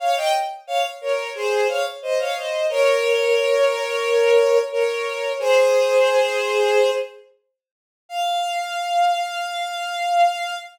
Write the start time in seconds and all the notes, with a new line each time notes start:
0.00 C#5 F5
0.17 D#5 G5
0.67 C#5 F5
1.01 A#4 C#5
1.35 G#4 C5
1.69 C#5 F5
2.02 C5 D#5
2.19 C#5 F5
2.36 C5 D#5
2.70 A#4 C#5
4.72 A#4 C#5
5.39 G#4 C5
8.09 F5